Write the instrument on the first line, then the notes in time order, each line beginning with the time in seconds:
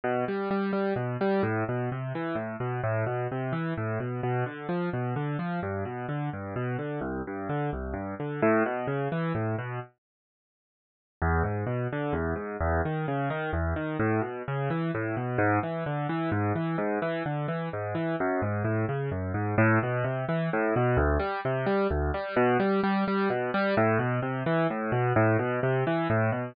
acoustic grand piano
0.03 B2
0.28 G3
0.50 G3
0.73 G3
0.96 B2
1.21 G3
1.43 A2
1.68 B2
1.91 C3
2.15 E3
2.35 A2
2.60 B2
2.83 A2
3.06 B2
3.31 C3
3.52 E3
3.77 A2
4.00 B2
4.23 B2
4.46 D3
4.69 F3
4.93 B2
5.16 D3
5.39 F3
5.62 G2
5.85 B2
6.08 D3
6.33 G2
6.56 B2
6.78 D3
7.01 C2
7.27 G2
7.49 D3
7.73 C2
7.93 G2
8.19 D3
8.42 A2
8.66 B2
8.87 C#3
9.12 E3
9.35 A2
9.58 B2
11.22 E2
11.43 G#2
11.66 B2
11.92 D3
12.13 E2
12.35 G#2
12.60 E2
12.85 D#3
13.08 C#3
13.30 D#3
13.53 E2
13.76 D#3
13.99 A2
14.21 B2
14.47 C#3
14.70 E3
14.94 A2
15.16 B2
15.38 G#2
15.63 E3
15.86 D3
16.09 E3
16.31 G#2
16.55 E3
16.78 G#2
17.02 E3
17.25 D3
17.48 E3
17.73 G#2
17.95 E3
18.20 F#2
18.42 G#2
18.64 A2
18.88 C#3
19.11 F#2
19.34 G#2
19.58 A2
19.83 B2
20.04 C3
20.28 E3
20.53 A2
20.76 B2
20.97 D2
21.19 G3
21.45 C3
21.66 G3
21.90 D2
22.14 G3
22.36 B2
22.59 G3
22.83 G3
23.07 G3
23.30 B2
23.54 G3
23.77 A2
23.99 B2
24.22 C3
24.46 E3
24.70 A2
24.92 B2
25.16 A2
25.39 B2
25.63 C3
25.87 E3
26.10 A2
26.32 B2